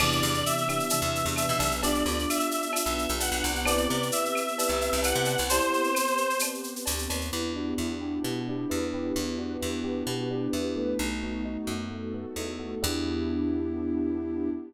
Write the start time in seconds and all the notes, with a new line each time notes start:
0.00 E2 C3 E3 B3 D4 E4 G4 D5, crash, cowbell, claves
0.12 shaker
0.23 E2 C3 E3, shaker
0.34 shaker
0.46 E5, shaker
0.58 shaker
0.69 B3 D4 E4 G4, claves, shaker
0.79 shaker
0.90 C3 E3 B3 D4 G4 B4, cowbell, shaker
1.02 E2, shaker
1.15 shaker
1.26 E2, shaker
1.36 E5, cowbell, claves, shaker
1.49 B2, shaker
1.60 B1, cowbell, shaker
1.71 shaker
1.82 B3 D4 F4 G4 D5, cowbell, shaker
1.95 shaker
2.06 D2 D4 F4, shaker
2.19 shaker
2.30 E5, claves, shaker
2.40 shaker
2.51 shaker
2.62 shaker
2.73 B3 D4 F4 G4 B4, cowbell, claves, shaker
2.86 B1, shaker
2.98 shaker
3.09 B1, shaker
3.20 F#5, cowbell, shaker
3.32 B1, shaker
3.44 C2, cowbell, shaker
3.55 shaker
3.65 B3 C4 E4 G4 B4 D5, cowbell, claves, shaker
3.78 shaker
3.88 C3 G4 B4, shaker
4.02 shaker
4.12 E5, shaker
4.25 shaker
4.35 claves, shaker
4.48 shaker
4.57 G4 B4, cowbell, shaker
4.68 C2, shaker
4.81 shaker
4.93 C2, shaker
5.03 F#5, cowbell, claves, shaker
5.15 C3, shaker
5.25 cowbell, shaker
5.38 C2, shaker
5.49 B3 C4 E4 G4 B4 C5, cowbell, shaker
5.61 shaker
5.73 shaker
5.84 shaker
5.95 claves, shaker
6.07 shaker
6.17 shaker
6.30 shaker
6.39 cowbell, claves, shaker
6.54 shaker
6.64 shaker
6.76 shaker
6.86 D2, cowbell, shaker
6.98 shaker
7.10 D#2, cowbell, shaker
7.21 shaker
7.32 E2 B3 D4 E4 G4
7.56 D4 F#4
7.78 E2 E4
8.01 G4
8.23 B2 B3 G4
8.36 F#4
8.48 D4 G4
8.69 E2 E4 B4
8.93 G4 B4
9.15 E2 B3 D4 E4 G4 B4
9.37 D4 F#4
9.61 E2 E4
9.84 G4
10.07 B2 B3 G4
10.19 F#4
10.31 D4 G4
10.53 E2 E4 B4
10.76 A3 B4
10.99 B1 A3 B3 D#4 F#4
11.23 B3
11.45 D#4
11.67 F#2 F#4
11.91 A3 B3 F#4 A4
12.14 B3
12.36 E2 D#4
12.59 F#4
12.82 E2 B3 D4 E4 G4